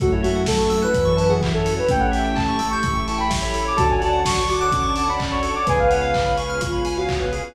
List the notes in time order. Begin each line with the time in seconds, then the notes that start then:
0.00 F#2 A3 C#4 E4 F#4 A4, kick, closed hi-hat
0.12 E4 C#5
0.23 A3 F#4 E5, open hi-hat
0.35 F#5
0.46 A4 A5, kick, snare
0.59 C#4 E4 F#4 A4 C#6
0.70 A3 C#4 E4 F#4 A4 E6, open hi-hat
0.82 B4 F#6
0.94 F#2 E3 C#4 E4 F#4 A4 E6, kick, closed hi-hat
1.05 C#6
1.17 C#4 E4 F#4 A4 B4 A5, open hi-hat
1.29 E3 C#4 E4 F#4 G#4 A4 F#5
1.41 E5, kick, clap
1.54 C#4 E4 F#4 A4 C#5
1.65 A4, open hi-hat
1.77 B4 C#5
1.89 A1 A3 C#4 E4 G4 A4 G5, kick, closed hi-hat
1.99 C#5 F#5
2.11 E5 G5, open hi-hat
2.24 G5
2.35 A5, kick, clap
2.48 C#4 E4 G4 A4 C#6
2.59 A3 C#4 E4 G4 A4 E6, open hi-hat
2.70 C#6 G6
2.83 A1 A3 C#4 E4 G4 A4 E6, kick, closed hi-hat
2.95 C#6
3.07 C#4 E4 G4 A4 A5 C#6, open hi-hat
3.18 C#4 E4 G4 A4 G5 B5
3.30 E5, kick, snare
3.42 C#4 E4 G4 A4 C#5 B5
3.54 A4, open hi-hat
3.65 C#5 D6
3.77 D2 C#4 D4 F#4 A4 C#5 D5 F#5 A5, kick, closed hi-hat
3.88 C#4 D4 F#4 A4 C#5 G#5
4.01 C#4 D4 F#4 A4 D5 A5, open hi-hat
4.13 F#5
4.25 A5 C#6, kick, snare
4.36 C#6
4.49 F#4 D6, open hi-hat
4.61 C#4 D4 F#4 A4 D6 F#6
4.72 C#4 D6, kick, closed hi-hat
4.83 C#6
4.96 A5 D6, open hi-hat
5.08 C#4 D4 F#4 A4 F#5 B5
5.19 D5, kick, clap
5.31 C#4 D4 F#4 A4 C#5 C#6
5.42 A4, open hi-hat
5.54 C#5 D6
5.67 C#2 B3 C#4 F4 G#4 B4 C#5 F5 G#5, kick, closed hi-hat
5.78 B3 C#4 F4 G#4 B4 F5
5.90 B3 C#4 F4 G#4 B4 C#5 F#5, open hi-hat
6.01 F5
6.14 G#5, kick, clap
6.26 B5
6.37 B4 C#6, open hi-hat
6.49 B3 C#4 F4 G#4 F6
6.60 F4 C#6, kick, closed hi-hat
6.72 B5
6.85 G#5, open hi-hat
6.97 B3 C#4 F4 F#4 G#4 F5
7.08 C#5, kick, clap
7.20 B3 C#4 F4 G#4 B4
7.32 G#4, open hi-hat
7.44 B4